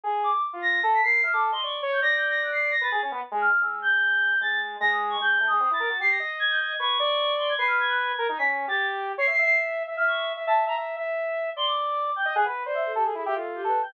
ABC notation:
X:1
M:2/4
L:1/16
Q:1/4=151
K:none
V:1 name="Choir Aahs"
z2 d'2 | z2 ^a'2 z b' c''2 | f' d' z c' ^c' z2 g' | (3^a'2 g'2 a'2 ^f' c''2 a' |
a'2 z4 f'2 | e'2 g'6 | a'2 z2 ^a' ^d'2 ^c' | (3g'4 ^d'4 a'4 |
c'' ^a'2 z ^g' =g' ^g'2 | ^c'6 =c' ^g' | c'' f' ^g' ^f' g'3 z | b' z2 a'2 z3 |
(3c''2 c''2 c''2 z4 | f' ^c'2 z2 a z ^a | z8 | c' d'5 g z |
^f z2 d e A G A | ^G e A2 (3=G2 B2 g2 |]
V:2 name="Lead 2 (sawtooth)"
^G3 z | z F3 A2 ^A2 | e A2 ^d =d2 ^c2 | d8 |
B ^G ^C B, z ^G,2 z | ^G,8 | ^G,4 G,4 | ^G,2 A, G, C E ^A ^F |
G2 ^d6 | B2 d6 | B6 ^A ^D | ^C3 G5 |
^c e e5 e | e4 e e2 e | e2 e6 | d6 z ^d |
^G B2 c3 A G | E G F3 A2 z |]